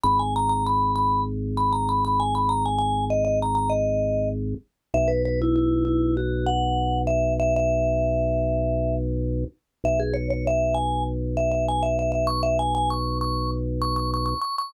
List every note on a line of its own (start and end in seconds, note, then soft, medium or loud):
0.03 4.55 G#1 loud
0.03 0.18 B5 medium
0.19 0.34 G#5 medium
0.36 0.49 A#5 medium
0.49 0.64 A#5 medium
0.66 0.92 B5 medium
0.96 1.21 B5 medium
1.57 1.72 B5 medium
1.72 1.87 A#5 medium
1.89 2.03 B5 medium
2.05 2.19 B5 medium
2.20 2.34 G#5 medium
2.35 2.49 B5 medium
2.49 2.64 A#5 medium
2.66 2.78 G#5 medium
2.78 3.05 G#5 medium
3.10 3.24 D#5 medium
3.25 3.39 D#5 medium
3.42 3.54 A#5 medium
3.55 3.70 A#5 medium
3.70 4.29 D#5 medium
4.94 9.44 B1 loud
4.94 5.09 E5 medium
5.08 5.22 B4 medium
5.25 5.40 B4 medium
5.42 5.55 E4 medium
5.56 5.83 E4 medium
5.85 6.14 E4 medium
6.17 6.47 F#4 medium
6.46 6.99 F#5 medium
7.07 7.34 E5 medium
7.40 7.54 E5 medium
7.56 8.95 E5 medium
9.84 14.34 B1 loud
9.84 9.99 E5 medium
9.99 10.14 G#4 medium
10.14 10.28 C#5 medium
10.30 10.45 C#5 medium
10.47 10.75 E5 medium
10.74 11.03 G#5 medium
11.37 11.51 E5 medium
11.51 11.66 E5 medium
11.68 11.83 G#5 medium
11.83 11.97 E5 medium
11.99 12.11 E5 medium
12.12 12.26 E5 medium
12.27 12.42 C#6 medium
12.43 12.57 E5 medium
12.59 12.74 G#5 medium
12.75 12.89 G#5 medium
12.90 13.18 C#6 medium
13.21 13.51 C#6 medium
13.82 13.96 C#6 medium
13.96 14.11 C#6 medium
14.14 14.25 C#6 medium
14.26 14.40 C#6 medium
14.41 14.56 C#6 medium
14.58 14.73 C#6 medium